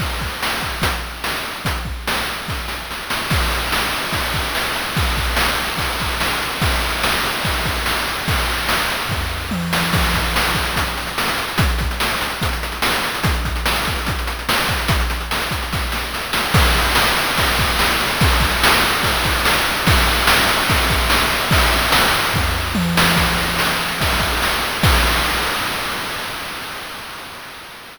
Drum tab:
CC |x---------------|----------------|x---------------|----------------|
RD |----------------|----------------|--x---x-x-x---x-|x-x---x-x-x---x-|
HH |--------x-------|x---------------|----------------|----------------|
SD |----o-------o---|----o---o-o-o-o-|----o-------o---|----o-------o---|
T1 |----------------|----------------|----------------|----------------|
FT |----------------|----------------|----------------|----------------|
BD |o-o---o-o-------|o-o-----o-------|o-------o-o-----|o-o-----o-o-----|

CC |----------------|----------------|x---------------|----------------|
RD |x-x---x-x-x---x-|x-x---x---------|----------------|----------------|
HH |----------------|----------------|-xxx-xxxxxxx-xxx|xxxx-xxxxxxx-xxx|
SD |----o-------o---|----o---------o-|----o-------o---|----o-------o---|
T1 |----------------|------------o---|----------------|----------------|
FT |----------------|--------o-------|----------------|----------------|
BD |o-------o-o-----|o-------o-------|o-o---o-o-------|o-o-----o-------|

CC |----------------|----------------|x---------------|----------------|
RD |----------------|----------------|--x---x-x-x---x-|x-x---x-x-x---x-|
HH |xxxx-xxxxxxx-xxx|xxxx-xxx--------|----------------|----------------|
SD |----o-------o---|----o---o-o-o-o-|----o-------o---|----o-------o---|
T1 |----------------|----------------|----------------|----------------|
FT |----------------|----------------|----------------|----------------|
BD |o-o---o-o-----o-|o-----o-o-------|o-------o-o-----|o-o-----o-o-----|

CC |----------------|----------------|x---------------|x---------------|
RD |x-x---x-x-x---x-|x-x---x---------|--x---x-x-x---x-|----------------|
HH |----------------|----------------|----------------|----------------|
SD |----o-------o---|----o---------o-|----o-------o---|----------------|
T1 |----------------|------------o---|----------------|----------------|
FT |----------------|--------o-------|----------------|----------------|
BD |o-------o-o-----|o-------o-------|o-------o-o-----|o---------------|